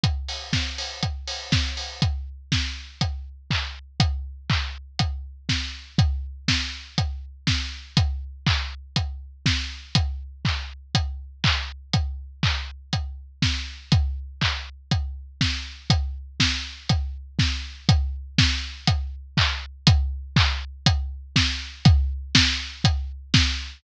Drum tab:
HH |xo-oxo-o|x---x---|x---x---|x---x---|
CP |--------|------x-|--x-----|--------|
SD |--o---o-|--o-----|------o-|--o---o-|
BD |o-o-o-o-|o-o-o-o-|o-o-o-o-|o-o-o-o-|

HH |x---x---|x---x---|x---x---|x---x---|
CP |--x-----|--x---x-|--x-----|--x-----|
SD |------o-|--------|------o-|------o-|
BD |o-o-o-o-|o-o-o-o-|o-o-o-o-|o-o-o-o-|

HH |x---x---|x---x---|x---x---|x---x---|
CP |--------|------x-|--x-----|--------|
SD |--o---o-|--o-----|------o-|--o---o-|
BD |o-o-o-o-|o-o-o-o-|o-o-o-o-|o-o-o-o-|